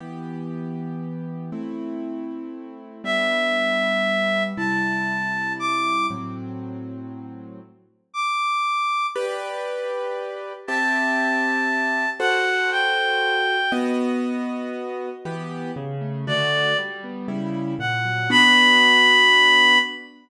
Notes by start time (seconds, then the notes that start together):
0.00 E3 B3 G4
1.52 A3 C4 E4
3.04 G3 B3 D4 E5
4.57 C3 G3 E4 A5
5.59 D6
6.10 A2 F#3 C4
8.14 D6
9.16 G4 B4 D5
10.67 C4 G4 E5 A5
12.20 F#4 A4 C5 F#5
12.71 G5
13.72 B3 F#4 D#5
15.25 E3 B3 G4
15.76 C#3
16.01 A3
16.27 D3 A3 F#4 D5
16.78 G3
17.04 B3
17.28 C#3 G3 E4
17.79 A#2 F#5
18.05 F#3
18.30 B3 D4 F#4 B5